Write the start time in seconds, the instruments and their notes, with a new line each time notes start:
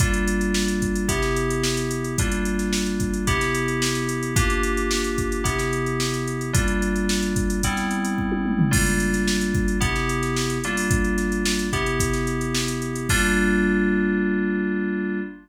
0.00 electric piano 2 G3 A#3 D4 F4, kick, closed hi-hat
0.14 closed hi-hat
0.28 closed hi-hat
0.41 closed hi-hat
0.54 snare
0.68 closed hi-hat
0.82 kick, closed hi-hat
0.96 closed hi-hat
1.08 electric piano 2 C3 B3 E4 G4, kick, closed hi-hat
1.22 snare, closed hi-hat
1.36 closed hi-hat
1.50 closed hi-hat
1.64 snare
1.77 snare, closed hi-hat
1.91 closed hi-hat
2.04 closed hi-hat
2.18 electric piano 2 G3 A#3 D4 F4, kick, closed hi-hat
2.32 closed hi-hat
2.45 closed hi-hat
2.59 snare, closed hi-hat
2.73 snare
2.86 closed hi-hat
3.00 kick, closed hi-hat
3.14 closed hi-hat
3.27 electric piano 2 C3 B3 E4 G4, kick, closed hi-hat
3.41 snare, closed hi-hat
3.55 closed hi-hat
3.68 closed hi-hat
3.82 snare
3.95 snare, closed hi-hat
4.09 closed hi-hat
4.23 closed hi-hat
4.36 electric piano 2 A#3 D4 F4 G4, kick, closed hi-hat
4.50 closed hi-hat
4.63 closed hi-hat
4.77 closed hi-hat
4.91 snare
5.04 closed hi-hat
5.18 kick, closed hi-hat
5.32 closed hi-hat
5.44 electric piano 2 C3 B3 E4 G4, kick, closed hi-hat
5.59 snare, closed hi-hat
5.73 closed hi-hat
5.86 closed hi-hat
6.00 snare
6.14 closed hi-hat
6.28 closed hi-hat
6.41 closed hi-hat
6.53 electric piano 2 G3 A#3 D4 F4, kick, closed hi-hat
6.68 closed hi-hat
6.82 closed hi-hat
6.96 closed hi-hat
7.09 snare
7.23 closed hi-hat
7.36 kick, closed hi-hat
7.50 closed hi-hat
7.63 electric piano 2 G3 B3 C4 E4, kick, closed hi-hat
7.77 snare, closed hi-hat
7.91 closed hi-hat
8.05 closed hi-hat
8.18 kick
8.32 high tom
8.46 mid tom
8.59 floor tom
8.71 electric piano 2 G3 A#3 D4 F4, kick, crash
8.86 closed hi-hat
9.00 closed hi-hat
9.14 snare, closed hi-hat
9.28 snare
9.41 closed hi-hat
9.55 kick, closed hi-hat
9.68 closed hi-hat
9.80 electric piano 2 C3 B3 E4 G4, kick, closed hi-hat
9.96 snare, closed hi-hat
10.09 closed hi-hat
10.23 snare, closed hi-hat
10.36 snare
10.50 closed hi-hat
10.64 electric piano 2 G3 A#3 D4 F4, closed hi-hat
10.77 open hi-hat
10.91 kick, closed hi-hat
11.04 closed hi-hat
11.18 snare, closed hi-hat
11.32 closed hi-hat
11.45 snare
11.59 closed hi-hat
11.73 electric piano 2 C3 B3 E4 G4, kick, closed hi-hat
11.86 closed hi-hat
12.00 kick, closed hi-hat
12.13 snare, closed hi-hat
12.27 closed hi-hat
12.41 closed hi-hat
12.55 snare
12.68 closed hi-hat
12.82 closed hi-hat
12.96 closed hi-hat
13.09 electric piano 2 G3 A#3 D4 F4, kick, crash